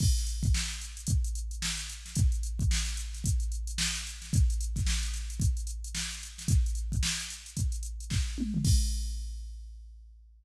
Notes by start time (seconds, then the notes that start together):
0.00 kick, crash
0.17 snare, closed hi-hat
0.27 closed hi-hat
0.43 kick, closed hi-hat
0.54 snare
0.70 closed hi-hat
0.81 closed hi-hat
0.97 closed hi-hat
1.07 kick, closed hi-hat
1.24 closed hi-hat
1.35 closed hi-hat
1.51 closed hi-hat
1.62 snare
1.77 closed hi-hat
1.89 closed hi-hat
2.06 snare, closed hi-hat
2.15 kick, closed hi-hat
2.32 closed hi-hat
2.43 closed hi-hat
2.59 kick, closed hi-hat
2.71 snare
2.86 closed hi-hat
2.97 closed hi-hat
3.13 snare, closed hi-hat
3.24 kick, closed hi-hat
3.40 closed hi-hat
3.52 closed hi-hat
3.67 closed hi-hat
3.78 snare
3.95 closed hi-hat
4.07 closed hi-hat
4.22 snare, closed hi-hat
4.33 kick, closed hi-hat
4.50 closed hi-hat
4.61 closed hi-hat
4.76 kick, snare, closed hi-hat
4.86 snare
5.03 closed hi-hat
5.14 snare, closed hi-hat
5.30 closed hi-hat
5.40 kick, closed hi-hat
5.57 closed hi-hat
5.67 closed hi-hat
5.84 closed hi-hat
5.95 snare
6.11 closed hi-hat
6.23 closed hi-hat
6.38 snare, closed hi-hat
6.48 kick, closed hi-hat
6.66 closed hi-hat
6.75 closed hi-hat
6.92 kick, closed hi-hat
7.03 snare
7.20 closed hi-hat
7.30 closed hi-hat
7.46 closed hi-hat
7.57 kick, closed hi-hat
7.72 closed hi-hat
7.83 closed hi-hat
8.00 closed hi-hat
8.10 kick, snare
8.38 mid tom
8.54 floor tom
8.65 kick, crash